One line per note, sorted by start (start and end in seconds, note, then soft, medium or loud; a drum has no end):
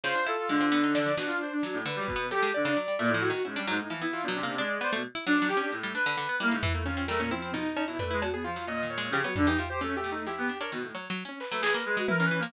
0.04 0.14 C#3 loud
0.04 0.66 F4 medium
0.04 0.24 C5 loud
0.15 0.25 D4 medium
0.27 0.37 E4 loud
0.27 0.47 A4 medium
0.27 closed hi-hat medium
0.49 1.10 D3 loud
0.49 0.59 G#3 medium
0.61 0.71 C4 medium
0.72 0.82 B3 loud
0.72 0.93 D4 medium
0.83 0.94 D#4 medium
0.95 1.05 D4 medium
0.95 1.15 D5 loud
0.95 snare medium
1.06 1.16 F3 medium
1.17 1.38 B2 medium
1.17 1.79 D4 medium
1.17 1.27 F#4 medium
1.17 snare medium
1.27 1.37 F4 medium
1.41 1.51 C5 medium
1.52 1.62 D4 medium
1.63 1.83 F#3 medium
1.63 1.74 F#3 medium
1.63 snare medium
1.73 1.83 A2 medium
1.85 1.99 D3 loud
1.85 2.26 B4 medium
1.85 closed hi-hat medium
1.96 2.06 G3 loud
2.01 2.14 F#3 medium
2.07 2.27 B2 medium
2.07 kick medium
2.16 2.30 B3 loud
2.31 2.41 F#3 medium
2.31 2.51 G4 loud
2.31 2.51 A4 medium
2.42 2.53 G#3 loud
2.54 2.66 D3 medium
2.54 3.15 D5 loud
2.65 2.75 C#3 loud
2.65 2.76 D4 medium
2.77 2.87 F#3 medium
2.88 2.98 G3 soft
2.99 3.09 A#2 loud
2.99 3.13 A3 medium
3.09 3.29 A2 loud
3.14 3.28 F3 loud
3.22 3.42 F#4 loud
3.30 3.43 D#3 medium
3.45 3.55 G#2 medium
3.45 3.65 C#4 medium
3.45 3.55 E4 medium
3.56 3.66 G3 medium
3.56 3.66 D4 loud
3.67 3.79 G#2 loud
3.67 3.78 F#3 loud
3.67 3.88 D#4 medium
3.79 3.89 A2 medium
3.79 3.89 D#4 medium
3.90 4.01 E3 medium
3.90 4.00 F3 medium
3.90 4.11 E4 medium
4.01 4.12 B3 medium
4.01 4.22 E4 medium
4.13 4.27 E3 medium
4.13 4.23 F4 loud
4.23 4.33 B2 medium
4.23 4.55 D4 medium
4.28 4.42 F#3 loud
4.35 4.45 C3 medium
4.43 4.57 A#3 loud
4.47 4.57 C3 medium
4.58 4.78 G#3 medium
4.58 4.68 D4 loud
4.58 4.99 D5 medium
4.81 4.91 B3 loud
4.81 4.93 C5 loud
4.93 5.03 B2 medium
4.93 5.03 A3 loud
5.15 5.25 E4 loud
5.26 5.40 F#3 loud
5.26 5.47 D4 loud
5.38 5.48 D4 medium
5.42 5.55 F#3 medium
5.48 5.58 G4 loud
5.48 5.60 G4 medium
5.48 snare medium
5.57 5.71 C#4 medium
5.57 5.71 D4 medium
5.57 5.71 G4 medium
5.72 5.92 A2 medium
5.72 5.82 G#3 medium
5.83 5.94 G3 loud
5.94 6.05 D4 medium
5.94 6.35 B4 loud
6.06 6.16 D3 loud
6.17 6.28 D3 loud
6.29 6.39 B3 medium
6.40 6.50 G3 loud
6.40 6.52 A#3 loud
6.40 6.81 E4 medium
6.51 6.62 G#2 medium
6.51 6.62 C#3 medium
6.62 6.73 E3 medium
6.62 6.73 E3 loud
6.62 floor tom medium
6.74 6.84 A3 medium
6.74 6.85 A#3 medium
6.84 6.96 D#3 medium
6.84 7.06 C#4 loud
6.84 7.05 F4 medium
6.97 7.07 C4 medium
7.08 7.18 G3 medium
7.08 7.20 A3 medium
7.08 7.29 A#4 loud
7.08 snare medium
7.19 7.29 A#2 medium
7.19 7.30 C#4 medium
7.31 7.62 F3 medium
7.31 7.52 C4 loud
7.31 7.41 E4 medium
7.42 7.52 E4 medium
7.53 7.74 B2 medium
7.53 7.84 D#4 loud
7.77 7.87 C#4 medium
7.77 cowbell loud
7.88 7.98 B2 soft
7.88 7.98 F#3 medium
7.88 7.98 E4 loud
7.99 8.10 A3 medium
7.99 8.09 D4 medium
7.99 8.20 B4 loud
7.99 floor tom medium
8.11 8.23 G#3 medium
8.11 8.21 E4 medium
8.21 8.32 B2 medium
8.21 8.32 F#4 medium
8.21 cowbell loud
8.33 8.43 B3 medium
8.33 8.44 G#4 medium
8.44 8.55 F3 medium
8.44 8.65 F4 medium
8.56 8.66 F#3 medium
8.66 9.07 A#2 medium
8.66 8.81 C#4 soft
8.66 8.88 D#5 medium
8.83 8.96 D#3 medium
8.90 9.11 C#5 medium
8.98 9.11 G#3 loud
9.11 9.21 C#3 loud
9.11 9.23 F3 medium
9.11 9.23 G4 loud
9.24 9.35 F#3 medium
9.24 9.34 B3 medium
9.24 9.35 C#5 medium
9.36 9.48 D3 loud
9.36 9.46 G3 medium
9.36 9.46 D4 loud
9.36 floor tom medium
9.46 9.57 E3 medium
9.46 9.57 D#4 medium
9.46 9.58 G4 medium
9.57 9.69 C3 medium
9.57 9.69 F4 medium
9.57 9.68 G4 medium
9.70 9.80 G4 medium
9.70 9.80 C5 medium
9.81 9.91 F#3 medium
9.81 10.22 A3 medium
9.81 9.95 C#4 loud
9.97 10.10 G4 loud
10.04 10.24 B2 medium
10.12 10.25 D#4 medium
10.26 10.47 F3 medium
10.26 10.36 E4 medium
10.26 10.57 G4 medium
10.38 10.48 B3 loud
10.49 10.59 D4 medium
10.60 10.71 D4 medium
10.60 10.70 A#4 medium
10.60 10.71 C#5 medium
10.71 10.82 B2 medium
10.71 10.92 D#3 medium
10.82 10.93 A2 medium
10.95 11.08 F#3 medium
10.95 11.05 C#5 medium
11.10 11.24 F#3 loud
11.25 11.39 C#4 medium
11.40 12.02 B4 medium
11.40 clap medium
11.51 11.62 F#3 loud
11.51 11.61 A3 medium
11.61 11.73 E3 medium
11.61 11.71 G#4 loud
11.61 clap loud
11.73 11.84 A#3 loud
11.73 11.83 A#4 medium
11.85 11.96 G#3 loud
11.97 12.07 G#3 loud
11.97 12.07 F#4 medium
12.08 12.19 E4 medium
12.08 12.23 A#4 loud
12.08 12.18 B4 medium
12.08 high tom medium
12.20 12.30 E3 medium
12.20 12.40 C#4 medium
12.25 12.38 B4 loud
12.31 12.41 E3 medium
12.39 12.52 F3 loud
12.39 12.52 A#3 loud